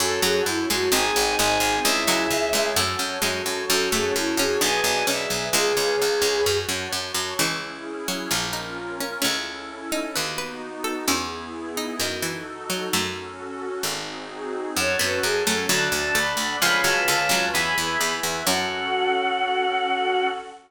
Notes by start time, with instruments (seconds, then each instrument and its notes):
0.00 harpsichord F#2, electric piano 1 C#4 F#4 A4, violin A4, pad 5 (bowed) C#5 F#5 A5
0.22 harpsichord F#2 F#3, violin G#4
0.46 harpsichord F#2, violin E4, pad 5 (bowed) C#5 A5 C#6
0.69 harpsichord F#2 G#3, violin F#4
0.92 harpsichord G#1 C4, electric piano 1 C4 D#4 G#4, pad 5 (bowed) C5 D#5 G#5, violin G#5
1.16 harpsichord G#1
1.38 harpsichord G#1 G#3, pad 5 (bowed) G#4 C5 G#5, violin G#5
1.60 harpsichord G#1
1.84 harpsichord C#2, electric piano 1 C#4 E4 G#4, pad 5 (bowed) C#5 E5 G#5, violin E5
2.07 harpsichord C#2 F#3
2.30 harpsichord C#2, pad 5 (bowed) G#4 C#5 G#5
2.53 harpsichord C#2 G#3
2.76 harpsichord F#2 A3, electric piano 1 C#4 F#4 A4, pad 5 (bowed) C#5 F#5 A5
2.99 harpsichord F#2
3.22 harpsichord F#2 G#3, pad 5 (bowed) C#5 A5 C#6
3.46 harpsichord F#2
3.69 harpsichord F#2, electric piano 1 C#4 F#4 A4, violin A4, pad 5 (bowed) C#5 F#5 A5
3.92 harpsichord F#2 A3, violin G#4
4.15 harpsichord F#2, violin E4, pad 5 (bowed) C#5 A5 C#6
4.37 harpsichord F#2 C#4, violin G#4
4.61 harpsichord B1 D4, electric piano 1 B3 D4 G#4, pad 5 (bowed) B4 D5 G#5, violin G#5
4.84 harpsichord B1
5.07 harpsichord B1 C#4, pad 5 (bowed) G#4 B4 G#5, violin E5
5.30 harpsichord B1
5.53 harpsichord C#2 G#3, violin G#4, pad 5 (bowed) B4 C#5 F5 G#5
5.77 harpsichord C#2, violin G#4
6.00 harpsichord C#2, pad 5 (bowed) B4 C#5 G#5 B5
6.22 harpsichord C#2
6.46 harpsichord F#2, pad 5 (bowed) C#5 F#5 A5
6.69 harpsichord F#2
6.92 harpsichord F#2, pad 5 (bowed) C#5 A5 C#6
7.14 harpsichord F#2
7.39 harpsichord C#2 C#3 E3, pad 5 (bowed) C#4 E4 G#4
8.08 harpsichord F#3
8.31 harpsichord A#1 F4, pad 5 (bowed) C#4 F4 A#4
8.53 harpsichord D#4
9.00 harpsichord C#4
9.22 harpsichord C#2 A3 C#4, pad 5 (bowed) C#4 E4 A4
9.92 harpsichord D#4
10.15 harpsichord D#2 B4, pad 5 (bowed) B3 D#4 F#4
10.38 harpsichord B4
10.84 harpsichord A4
11.08 harpsichord E2 C#4 E4, pad 5 (bowed) B3 E4 G#4
11.77 harpsichord D#4
12.00 harpsichord F#2 D#3, pad 5 (bowed) D#4 F#4 A4
12.22 harpsichord E3
12.70 harpsichord F#3
12.93 harpsichord F#2 F#3 A3, pad 5 (bowed) C#4 F#4 A4
13.83 harpsichord G#1, pad 5 (bowed) C4 D#4 F#4 G#4
14.77 harpsichord F#2, pad 5 (bowed) C#4 F#4 A4, violin C#5, electric piano 1 C#5 F#5 A5
14.99 harpsichord F#2 B3, violin B4
15.23 harpsichord F#2, pad 5 (bowed) C#4 A4 C#5, violin G#4
15.46 harpsichord F#2 A3, violin A4
15.69 harpsichord D2 F#3, pad 5 (bowed) D4 F#4 A4, electric piano 1 D5 F#5 A5, violin A5
15.92 harpsichord D2
16.15 harpsichord D2 A3, pad 5 (bowed) D4 A4 D5, violin B5
16.37 harpsichord D2
16.61 harpsichord C#2 F3, pad 5 (bowed) C#4 F4 G#4 B4, electric piano 1 C#5 F5 G#5 B5, violin B5
16.84 harpsichord C#2 F#3, violin A5
17.07 harpsichord C#2 D3, pad 5 (bowed) C#4 F4 B4 C#5, violin A5
17.29 harpsichord C#2 F#3
17.54 harpsichord E2, pad 5 (bowed) E4 G#4 B4, electric piano 1 E5 G#5 B5, violin B5
17.78 harpsichord E2
18.00 harpsichord E2, pad 5 (bowed) E4 B4 E5
18.23 harpsichord E2
18.46 harpsichord F#2 F#3, pad 5 (bowed) C#4 F#4 A4, electric piano 1 C#4 F#4 A4, violin F#5